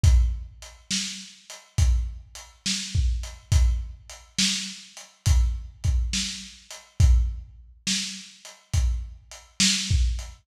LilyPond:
\new DrumStaff \drummode { \time 4/4 \tempo 4 = 69 \tuplet 3/2 { <hh bd>8 r8 hh8 sn8 r8 hh8 <hh bd>8 r8 hh8 sn8 bd8 hh8 } | \tuplet 3/2 { <hh bd>8 r8 hh8 sn8 r8 hh8 <hh bd>8 r8 <hh bd>8 sn8 r8 hh8 } | <hh bd>4 \tuplet 3/2 { sn8 r8 hh8 <hh bd>8 r8 hh8 sn8 bd8 hh8 } | }